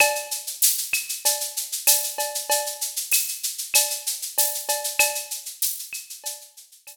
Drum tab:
TB |----x-------x---|----x-------x---|----x-------x---|
SH |xxxxxxxxxxxxxxxx|xxxxxxxxxxxxxxxx|xxxxxxxxxxxxx---|
CB |x-------x---x-x-|x-------x---x-x-|x-------x---x---|
CL |x-----x-----x---|----x---x-------|x-----x-----x---|